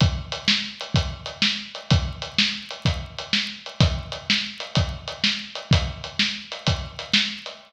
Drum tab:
HH |x-x--xx-x--x|x-x--xx-x--x|x-x--xx-x--x|x-x--xx-x--x|
SD |---o-----o--|---o-----o--|---o-----o--|---o-----o--|
BD |o-----o-----|o-----o-----|o-----o-----|o-----o-----|